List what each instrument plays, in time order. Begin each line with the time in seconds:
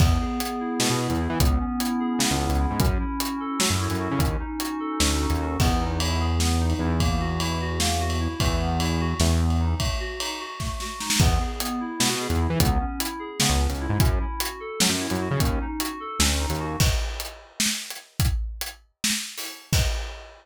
0.00 synth bass 1 E2, electric piano 2 B3, kick, crash
0.21 electric piano 2 G#4
0.39 electric piano 2 B3, closed hi-hat
0.60 electric piano 2 E4
0.80 synth bass 1 B2, electric piano 2 B3, snare
0.90 synth bass 1 B2
1.00 electric piano 2 G#4
1.10 synth bass 1 E2, closed hi-hat
1.20 electric piano 2 E4
1.30 synth bass 1 E3
1.40 synth bass 1 C#2, electric piano 2 B3, kick, closed hi-hat
1.60 electric piano 2 C#4
1.79 electric piano 2 E4, closed hi-hat
2.00 electric piano 2 G#4
2.19 synth bass 1 C#3, electric piano 2 B3, snare
2.31 synth bass 1 C#2
2.41 electric piano 2 C#4
2.49 synth bass 1 C#2, closed hi-hat
2.60 electric piano 2 E4
2.70 synth bass 1 G#2
2.80 synth bass 1 F#2, electric piano 2 C#4, kick, closed hi-hat
3.00 electric piano 2 E4
3.20 electric piano 2 F#4, closed hi-hat
3.40 electric piano 2 A4
3.60 synth bass 1 F#3, electric piano 2 C#4, snare
3.70 synth bass 1 F#2
3.80 electric piano 2 E4
3.90 synth bass 1 F#2, closed hi-hat
4.00 electric piano 2 F#4
4.11 synth bass 1 C#3
4.19 synth bass 1 D#2, electric piano 2 C#4, kick, closed hi-hat
4.40 electric piano 2 D#4
4.60 electric piano 2 F#4, closed hi-hat
4.80 electric piano 2 A4
5.00 synth bass 1 D2, electric piano 2 C#4, snare
5.20 electric piano 2 D#4
5.30 synth bass 1 D#2, closed hi-hat
5.40 electric piano 2 F#4
5.60 synth bass 1 E2, electric piano 2 B3, kick, crash
5.80 electric piano 2 D#4
6.00 electric piano 2 E4, ride
6.20 electric piano 2 G#4
6.40 electric piano 2 B3, snare
6.60 electric piano 2 D#4
6.70 ride
6.79 synth bass 1 E2, electric piano 2 E4
7.00 electric piano 2 A#3, kick, ride
7.20 electric piano 2 F#4
7.40 electric piano 2 E4, ride
7.61 electric piano 2 F#4
7.80 electric piano 2 A#3, snare
8.00 electric piano 2 F#4
8.10 ride
8.20 electric piano 2 E4
8.40 synth bass 1 E2, electric piano 2 A3, kick, ride
8.61 electric piano 2 B3
8.80 electric piano 2 E4, ride
9.00 electric piano 2 F#4
9.20 synth bass 1 E2, electric piano 2 A3, snare
9.41 electric piano 2 B3
9.50 ride
9.60 electric piano 2 D#4
9.80 electric piano 2 A3, kick, ride
10.00 electric piano 2 F#4
10.20 electric piano 2 D#4, ride
10.40 electric piano 2 F#4
10.60 electric piano 2 A3, kick, snare
10.80 electric piano 2 F#4, snare
11.00 electric piano 2 D#4, snare
11.10 snare
11.20 synth bass 1 E2, electric piano 2 B3, kick, crash
11.40 electric piano 2 G#4
11.60 electric piano 2 B3, closed hi-hat
11.80 electric piano 2 E4
12.00 synth bass 1 B2, electric piano 2 B3, snare
12.09 synth bass 1 B2
12.20 electric piano 2 G#4
12.30 synth bass 1 E2, closed hi-hat
12.41 electric piano 2 E4
12.50 synth bass 1 E3
12.60 synth bass 1 C#2, electric piano 2 B3, kick, closed hi-hat
12.80 electric piano 2 C#4
12.99 electric piano 2 E4, closed hi-hat
13.19 electric piano 2 G#4
13.40 synth bass 1 C#3, electric piano 2 B3, snare
13.50 synth bass 1 C#2
13.60 electric piano 2 C#4
13.70 synth bass 1 C#2, closed hi-hat
13.80 electric piano 2 E4
13.89 synth bass 1 G#2
14.00 synth bass 1 F#2, electric piano 2 C#4, kick, closed hi-hat
14.20 electric piano 2 E4
14.40 electric piano 2 F#4, closed hi-hat
14.60 electric piano 2 A4
14.80 synth bass 1 F#3, electric piano 2 C#4, snare
14.89 synth bass 1 F#2
15.00 electric piano 2 E4
15.10 synth bass 1 F#2, closed hi-hat
15.21 electric piano 2 F#4
15.31 synth bass 1 C#3
15.40 synth bass 1 D#2, electric piano 2 C#4, kick, closed hi-hat
15.61 electric piano 2 D#4
15.80 electric piano 2 F#4, closed hi-hat
16.00 electric piano 2 A4
16.19 synth bass 1 D2, electric piano 2 C#4, snare
16.40 electric piano 2 D#4
16.50 synth bass 1 D#2, closed hi-hat
16.60 electric piano 2 F#4
16.80 kick, crash
17.20 closed hi-hat
17.60 snare
17.90 closed hi-hat
18.20 kick, closed hi-hat
18.61 closed hi-hat
19.04 snare
19.38 open hi-hat
19.73 kick, crash